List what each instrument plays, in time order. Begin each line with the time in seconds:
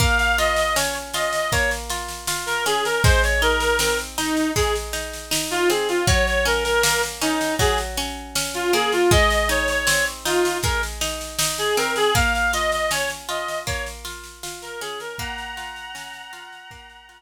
0.00 orchestral harp A#3, clarinet F5, kick, snare
0.19 clarinet F5, snare
0.38 orchestral harp F4, clarinet D#5, snare
0.56 clarinet D#5, snare
0.76 orchestral harp C#4, clarinet C#5, snare
0.94 snare
1.13 orchestral harp F4, clarinet D#5, snare
1.33 snare
1.52 orchestral harp A#3, clarinet C#5, kick, snare
1.71 snare
1.90 orchestral harp F4, snare
2.09 snare
2.27 orchestral harp F4, snare
2.46 clarinet A#4, snare
2.66 orchestral harp C#4, clarinet G#4, snare
2.85 clarinet A#4, snare
3.04 orchestral harp G#3, clarinet C5, kick, snare
3.23 clarinet C#5, snare
3.42 orchestral harp D#4, clarinet A#4, snare
3.60 clarinet A#4, snare
3.79 orchestral harp C4, clarinet A#4, snare
3.99 snare
4.18 clarinet D#4, orchestral harp D#4, snare
4.37 snare
4.56 orchestral harp G#3, clarinet G#4, kick, snare
4.75 snare
4.93 orchestral harp D#4, snare
5.13 snare
5.31 orchestral harp D#4, snare
5.51 clarinet F4, snare
5.69 orchestral harp C4, clarinet G#4, snare
5.89 clarinet F4, snare
6.07 orchestral harp F#3, clarinet C#5, kick, snare
6.26 clarinet C#5, snare
6.45 orchestral harp C#4, clarinet A#4, snare
6.64 clarinet A#4, snare
6.83 orchestral harp A#3, clarinet A#4, snare
7.03 snare
7.21 orchestral harp C#4, clarinet D#4, snare
7.41 snare
7.59 orchestral harp F#3, clarinet G#4, kick, snare
7.78 snare
7.97 orchestral harp C#4, snare
8.35 orchestral harp C#4, snare
8.54 clarinet F4, snare
8.73 orchestral harp A#3, clarinet G#4, snare
8.92 clarinet F4, snare
9.11 orchestral harp G#3, clarinet D#5, kick, snare
9.30 clarinet D#5, snare
9.49 orchestral harp D#4, clarinet C#5, snare
9.68 clarinet C#5, snare
9.87 orchestral harp C4, clarinet C#5, snare
10.06 snare
10.25 orchestral harp D#4, clarinet F4, snare
10.45 snare
10.63 orchestral harp G#3, clarinet A#4, kick, snare
10.83 snare
11.01 orchestral harp D#4, snare
11.21 snare
11.39 orchestral harp D#4, snare
11.58 clarinet G#4, snare
11.77 orchestral harp C4, clarinet A#4, snare
11.96 clarinet G#4, snare
12.15 orchestral harp A#3, clarinet F5, kick, snare
12.34 clarinet F5, snare
12.53 orchestral harp F4, clarinet D#5, snare
12.72 clarinet D#5, snare
12.91 orchestral harp C#4, clarinet C#5, snare
13.09 snare
13.29 orchestral harp F4, clarinet D#5, snare
13.48 snare
13.67 orchestral harp A#3, clarinet C#5, kick, snare
13.86 snare
14.05 orchestral harp F4, snare
14.24 snare
14.43 orchestral harp F4, snare
14.62 clarinet A#4, snare
14.81 orchestral harp C#4, clarinet G#4, snare
15.00 clarinet A#4, snare
15.19 orchestral harp A#3, clarinet F#5 A#5, kick, snare
15.38 snare
15.57 orchestral harp F4, snare
15.76 snare
15.95 orchestral harp C#4, snare
16.13 snare
16.33 orchestral harp F4, snare
16.52 snare
16.71 orchestral harp A#3, kick, snare
16.89 snare
17.09 orchestral harp F4, snare